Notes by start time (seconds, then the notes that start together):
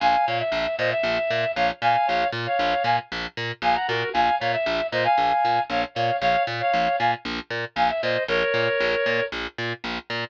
0.00 A#1 F5 G#5
0.26 A#2 C#5 F5
0.39 E5
0.52 A#1
0.78 A#2 C5 D#5
0.91 E5
1.03 A#1
1.30 A#2
1.55 A#1 C#5 F5
1.81 A#2 F5 G#5
2.06 A#1 C#5 F5
2.32 A#2
2.46 C#5 F5
2.59 A#1
2.84 A#2 F5 G#5
3.12 A#1
3.37 A#2
3.62 A#1 F5 G#5
3.75 F#5 A#5
3.88 A#2 F#4 A#4
4.13 A#1 F5 G#5
4.40 A#2 C#5 F5
4.52 E5
4.66 A#1
4.92 A#2 C5 D#5
5.04 F5 G#5
5.18 A#1
5.45 A#2
5.69 A#1 C#5 F5
5.95 A#2 C#5 F5
6.21 A#1 C#5 F5
6.47 A#2
6.60 C#5 F5
6.73 A#1
6.99 A#2 F5 G#5
7.25 A#1
7.50 A#2
7.76 A#1 F5 G#5
7.89 E5
8.02 A#2 C5 D#5
8.28 A#1 A#4 C#5
8.54 A#2
8.80 A#1
9.06 A#2
9.32 A#1
9.58 A#2
9.84 A#1
10.10 A#2